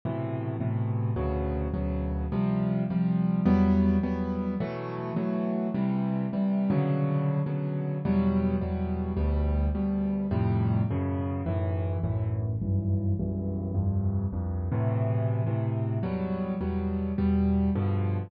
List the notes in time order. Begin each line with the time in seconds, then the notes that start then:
0.05 A2 B2 C3 E3
0.60 A2 B2 C3 E3
1.16 D2 B2 C#3 F#3
1.74 D2 B2 C#3 F#3
2.32 C3 F3 G3
2.90 C3 F3 G3
3.45 E2 F#3 G3 B3
4.03 E2 F#3 G3 B3
4.60 B2 E3 F#3 A3
5.16 B2 E3 F#3 A3
5.74 C3 E3 G3
6.33 C3 E3 G3
6.70 B2 C#3 D3 F#3
7.46 B2 C#3 D3 F#3
8.05 E2 B2 F#3 G3
8.61 E2 B2 F#3 G3
9.17 D2 B2 G3
9.75 D2 B2 G3
10.31 F2 A2 C3 G3
10.90 F#2 B2 C#3
11.46 B1 F#2 A2 E3
12.03 B1 F#2 A2 E3
12.62 B1 F#2 G2 E3
13.20 B1 F#2 G2 E3
13.74 C2 F2 G2
14.33 C2 F2 G2
14.72 A2 B2 C3 E3
15.47 A2 B2 C3 E3
16.03 E2 B2 F#3 G3
16.61 E2 B2 F#3 G3
17.18 E2 B2 G3
17.75 G2 B2 D3 F3